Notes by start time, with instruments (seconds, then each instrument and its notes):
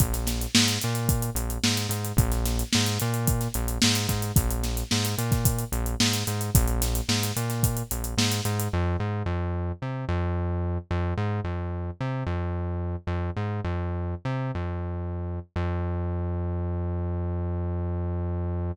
0.00 synth bass 1 A#1, kick, closed hi-hat
0.13 snare, closed hi-hat
0.27 snare, closed hi-hat
0.41 closed hi-hat
0.55 synth bass 1 G#2, snare
0.68 closed hi-hat
0.82 synth bass 1 A#2, closed hi-hat
0.95 closed hi-hat
1.09 kick, closed hi-hat
1.22 closed hi-hat
1.35 synth bass 1 A#1, closed hi-hat
1.50 closed hi-hat
1.64 synth bass 1 G#2, snare
1.77 closed hi-hat
1.89 synth bass 1 G#2, closed hi-hat
2.05 closed hi-hat
2.17 synth bass 1 A#1, kick, closed hi-hat
2.31 snare, closed hi-hat
2.45 snare, closed hi-hat
2.59 closed hi-hat
2.73 synth bass 1 G#2, snare
2.86 closed hi-hat
3.00 synth bass 1 A#2, closed hi-hat
3.14 closed hi-hat
3.27 kick, closed hi-hat
3.41 snare, closed hi-hat
3.54 synth bass 1 A#1, closed hi-hat
3.68 closed hi-hat
3.82 synth bass 1 G#2, snare
3.95 closed hi-hat
4.09 synth bass 1 G#2, kick, snare, closed hi-hat
4.22 closed hi-hat
4.36 synth bass 1 A#1, kick, closed hi-hat
4.51 closed hi-hat
4.63 snare, closed hi-hat
4.77 closed hi-hat
4.91 synth bass 1 G#2, snare
5.05 closed hi-hat
5.18 synth bass 1 A#2, closed hi-hat
5.32 kick, snare, closed hi-hat
5.45 kick, closed hi-hat
5.59 closed hi-hat
5.72 synth bass 1 A#1, closed hi-hat
5.86 closed hi-hat
6.00 synth bass 1 G#2, snare
6.14 closed hi-hat
6.27 synth bass 1 G#2, closed hi-hat
6.41 closed hi-hat
6.55 synth bass 1 A#1, kick, closed hi-hat
6.68 closed hi-hat
6.82 snare, closed hi-hat
6.95 closed hi-hat
7.09 synth bass 1 G#2, snare
7.23 closed hi-hat
7.36 synth bass 1 A#2, closed hi-hat
7.50 snare, closed hi-hat
7.63 kick, closed hi-hat
7.77 closed hi-hat
7.91 synth bass 1 A#1, closed hi-hat
8.04 closed hi-hat
8.18 synth bass 1 G#2, snare
8.31 snare, closed hi-hat
8.45 synth bass 1 G#2, closed hi-hat
8.60 closed hi-hat
8.73 synth bass 1 F2
9.00 synth bass 1 G#2
9.26 synth bass 1 F2
9.82 synth bass 1 C3
10.09 synth bass 1 F2
10.91 synth bass 1 F2
11.17 synth bass 1 G#2
11.44 synth bass 1 F2
12.00 synth bass 1 C3
12.26 synth bass 1 F2
13.07 synth bass 1 F2
13.36 synth bass 1 G#2
13.64 synth bass 1 F2
14.25 synth bass 1 C3
14.55 synth bass 1 F2
15.56 synth bass 1 F2